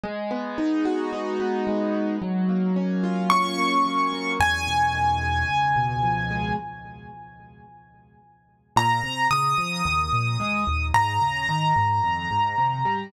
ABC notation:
X:1
M:4/4
L:1/8
Q:1/4=110
K:G#m
V:1 name="Acoustic Grand Piano"
z8 | z4 c'4 | g8 | z8 |
[K:Ab] b2 e'6 | b8 |]
V:2 name="Acoustic Grand Piano"
G, B, D F D B, G, B, | F, A, C ^E C A, F, A, | E,, B,, D, G, C,, B,, ^E, G, | z8 |
[K:Ab] B,, C, D, F, E,, B,, A, E,, | A,, D, E, A,, F,, A,, C, G, |]